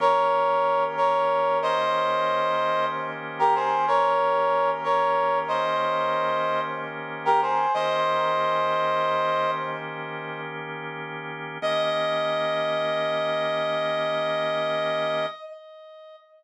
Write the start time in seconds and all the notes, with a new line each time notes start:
0.00 D#3 A#3 C#4 G4 A#4 C#5
0.97 A#4 C#5
1.62 C5 D#5
3.39 G4 A#4
3.55 G#4 C5
3.87 A#4 C#5
4.84 A#4 C#5
5.48 C5 D#5
7.25 G4 A#4
7.42 G#4 C5
7.74 D#3 A#3 C#4 G4 C5 D#5
11.62 D#3 A#3 C#4 G4 D#5